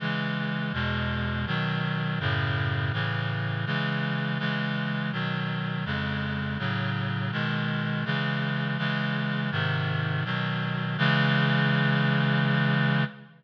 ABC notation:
X:1
M:3/4
L:1/8
Q:1/4=82
K:C#m
V:1 name="Clarinet" clef=bass
[C,E,G,]2 [E,,B,,G,]2 [B,,D,F,]2 | [F,,A,,C,]2 [A,,C,E,]2 [C,E,G,]2 | [C,E,G,]2 [B,,D,F,]2 [^E,,C,G,]2 | [A,,C,F,]2 [B,,D,G,]2 [C,E,G,]2 |
[C,E,G,]2 [G,,^B,,D,]2 [=B,,D,F,]2 | [C,E,G,]6 |]